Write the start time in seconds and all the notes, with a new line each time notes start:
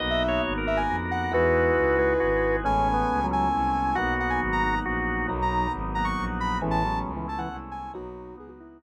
0.00 B1 A#3 B3 D#4 F#4 D#5
0.10 E5
0.28 C#5
0.45 G#1
0.58 A#4
0.66 A#3 B3 F#4 A#4 E5
0.77 G#5
0.87 F2
1.11 F#5
1.31 E2 G#3 D#4 E4 F#4 B4
1.75 C#2
1.98 G#3 D#4 F#4 G#4 B4
2.20 G#1 F#4
2.64 A1 G#3 A3 B3 C#4 G#5
2.94 B3
3.10 C#2
3.24 F#3
3.31 G#3 A3 C#4 E4 G#5
3.53 C2
3.95 B1 F#3 A#3 B3 D#4 F#4 F#5
4.20 F#5
4.30 G#5
4.40 G#1
4.53 A#5
4.64 F#3 A#3 D#4 F#4
4.85 A#1 F#4
5.28 B1 F#3 A#3 B3 D#4
5.42 A#5
5.73 G#1
5.95 F#3 A#3 D#4 F#4 A#5
6.05 C#6
6.17 A#1
6.40 B5
6.61 A1 E3 G#3 A3 B3 C#4
6.71 A5
6.84 F#3
7.06 C#2
7.16 E3
7.28 G#3 A3 C#4 E4 A5
7.38 E3 F#5
7.50 C2
7.71 G#5
7.94 B1 F#3 A#3 B3 D#4 F#4
8.37 C#2 B3 G#4
8.48 F#4
8.60 F#3 A#3 D#4 E4 F#4
8.81 A#1